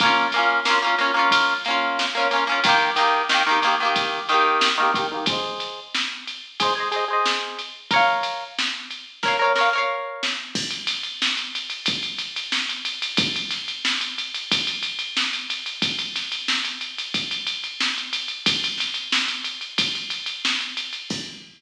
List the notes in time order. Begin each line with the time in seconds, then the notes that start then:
0.00 A#3 C#4, kick, ride
0.06 F4
0.32 A#3, ride
0.36 C#4 F4
0.65 A#3 C#4, snare
0.70 F4
0.82 A#3 C#4
0.87 F4
0.98 A#3 C#4, ride
1.03 F4
1.14 A#3 C#4
1.19 F4
1.31 kick, ride
1.65 A#3 C#4, ride
1.70 F4
1.99 snare
2.15 A#3 C#4
2.20 F4
2.31 A#3 C#4, ride
2.36 F4
2.47 A#3 C#4
2.52 F4
2.64 D#3 A#3, kick, ride
2.69 G4
2.96 D#3 A#3, ride
3.01 G4
3.29 D#3 A#3, snare
3.34 G4
3.47 D#3 A#3
3.51 G4
3.62 D#3 A#3, ride
3.67 G4
3.80 D#3 A#3
3.85 G4
3.96 kick, ride
4.29 D#3 A#3, ride
4.34 G4
4.61 snare
4.78 D#3 A#3
4.82 G4
4.94 D#3 A#3, kick, ride
4.98 G4
5.12 D#3 A#3
5.16 G4
5.26 G#4 C5, kick, ride
5.32 D#5
5.60 ride
5.95 snare
6.27 ride
6.60 G#4 C5, kick, ride
6.65 D#5
6.75 G#4 C5
6.80 D#5
6.91 G#4 C5, ride
6.96 D#5
7.08 G#4 C5
7.13 D#5
7.26 snare
7.59 ride
7.91 A#4 C#5, kick, ride
7.96 F5
8.23 ride
8.59 snare
8.91 ride
9.23 A#4 C#5, kick, snare
9.28 F5
9.39 A#4 C#5
9.44 F5
9.55 A#4 C#5, snare
9.61 F5
9.73 A#4 C#5
9.78 F5
10.23 snare
10.55 kick, crash
10.71 ride
10.87 snare, ride
11.03 ride
11.22 snare
11.37 ride
11.55 ride
11.70 ride
11.86 kick, ride
12.03 ride
12.19 ride
12.36 ride
12.52 snare
12.69 ride
12.85 ride
13.02 ride
13.17 kick, ride
13.36 ride
13.51 snare, ride
13.68 ride
13.85 snare
14.01 ride
14.18 ride
14.34 ride
14.52 kick, ride
14.67 ride
14.83 ride
14.99 ride
15.17 snare
15.33 ride
15.50 ride
15.66 ride
15.82 kick, ride
15.99 ride
16.16 snare, ride
16.32 ride
16.48 snare
16.65 ride
16.81 ride
16.98 ride
17.14 kick, ride
17.31 ride
17.47 ride
17.64 ride
17.80 snare
17.98 ride
18.13 ride
18.28 ride
18.46 kick, ride
18.64 ride
18.78 snare, ride
18.94 ride
19.12 snare
19.28 ride
19.45 ride
19.61 ride
19.78 kick, ride
19.95 ride
20.10 ride
20.26 ride
20.45 snare
20.61 ride
20.77 ride
20.93 ride
21.10 kick, crash